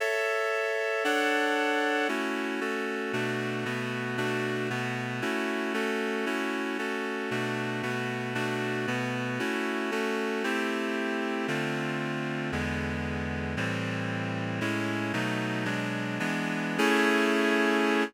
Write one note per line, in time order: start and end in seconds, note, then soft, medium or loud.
0.00 1.04 A4 medium
0.00 1.04 C#5 medium
0.00 1.04 E5 medium
1.04 2.08 D4 medium
1.04 2.08 A4 medium
1.04 2.08 C#5 medium
1.04 2.08 F#5 medium
2.08 2.60 A3 medium
2.08 2.60 C#4 medium
2.08 2.60 E4 medium
2.08 2.60 F#4 medium
2.61 3.12 A3 medium
2.61 3.12 C#4 medium
2.61 3.12 F#4 medium
2.61 3.12 A4 medium
3.13 3.65 B2 medium
3.13 3.65 A3 medium
3.13 3.65 D4 medium
3.13 3.65 F#4 medium
3.65 4.17 B2 medium
3.65 4.17 A3 medium
3.65 4.17 B3 medium
3.65 4.17 F#4 medium
4.17 4.69 B2 medium
4.17 4.69 A3 medium
4.17 4.69 D4 medium
4.17 4.69 F#4 medium
4.70 5.22 B2 medium
4.70 5.21 A3 medium
4.70 5.22 B3 medium
4.70 5.21 F#4 medium
5.22 5.73 A3 medium
5.22 5.73 C#4 medium
5.22 5.73 E4 medium
5.22 5.73 F#4 medium
5.74 6.25 A3 medium
5.74 6.25 C#4 medium
5.74 6.25 F#4 medium
5.74 6.25 A4 medium
6.26 6.78 A3 medium
6.26 6.78 C#4 medium
6.26 6.78 E4 medium
6.26 6.78 F#4 medium
6.78 7.30 A3 medium
6.78 7.30 C#4 medium
6.78 7.30 F#4 medium
6.78 7.30 A4 medium
7.31 7.82 B2 medium
7.31 7.82 A3 medium
7.31 7.82 D4 medium
7.31 7.82 F#4 medium
7.83 8.34 B2 medium
7.83 8.34 A3 medium
7.83 8.34 B3 medium
7.83 8.34 F#4 medium
8.35 8.86 B2 medium
8.35 8.86 A3 medium
8.35 8.86 D4 medium
8.35 8.86 F#4 medium
8.87 9.39 B2 medium
8.87 9.39 A3 medium
8.87 9.39 B3 medium
8.87 9.39 F#4 medium
9.39 9.91 A3 medium
9.39 9.91 C#4 medium
9.39 9.91 E4 medium
9.39 9.91 F#4 medium
9.91 10.43 A3 medium
9.91 10.43 C#4 medium
9.91 10.43 F#4 medium
9.91 10.43 A4 medium
10.44 11.47 A3 medium
10.44 11.47 C4 medium
10.44 11.47 E4 medium
10.44 11.47 G4 medium
11.48 12.51 D3 medium
11.48 12.51 A3 medium
11.48 12.51 C4 medium
11.48 12.51 F4 medium
12.52 13.55 E2 medium
12.52 13.55 D3 medium
12.52 13.55 G#3 medium
12.52 13.55 B3 medium
13.57 14.60 A2 medium
13.57 14.60 E3 medium
13.57 14.60 G3 medium
13.57 14.60 C4 medium
14.61 15.12 A2 medium
14.61 15.12 G#3 medium
14.61 15.12 C#4 medium
14.61 15.12 E4 medium
15.13 15.64 B2 medium
15.13 15.64 F#3 medium
15.13 15.65 A3 medium
15.13 15.65 D#4 medium
15.65 16.19 B2 medium
15.65 16.19 F#3 medium
15.65 16.19 G#3 medium
15.65 16.19 D4 medium
16.20 16.78 E3 medium
16.20 16.78 G#3 medium
16.20 16.78 B3 medium
16.20 16.78 D4 medium
16.78 18.04 A3 loud
16.78 18.04 C#4 loud
16.78 18.04 E4 medium
16.78 18.04 G#4 loud